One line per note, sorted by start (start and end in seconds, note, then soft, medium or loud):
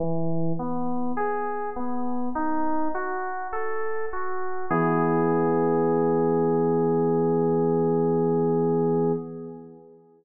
0.00 0.53 E3 loud
0.59 1.12 B3 medium
1.17 1.70 G#4 medium
1.76 2.29 B3 medium
2.35 2.88 D#4 loud
2.95 3.48 F#4 medium
3.52 4.05 A4 medium
4.13 4.66 F#4 medium
4.70 9.12 E3 loud
4.70 9.12 B3 medium
4.70 9.12 G#4 loud